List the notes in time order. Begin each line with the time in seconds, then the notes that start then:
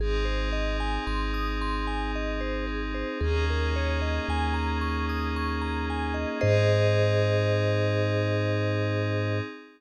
0.00 G#1 C4 D#4 G#4
0.25 C5
0.52 D#5
0.80 G#5
1.07 G#1 C6
1.34 D#6
1.61 C6
1.87 G#5
2.15 D#5
2.41 C5
2.67 G#4
2.94 C5
3.21 D#2 A#3 C#4 D#4 G#4
3.50 A#4
3.76 C#5
4.02 D#5
4.28 D#2 G#5
4.54 A#5
4.81 C#6
5.09 D#6
5.36 C#6
5.62 A#5
5.90 G#5
6.14 D#5
6.41 G#2 C4 D#4 G#4 C5 D#5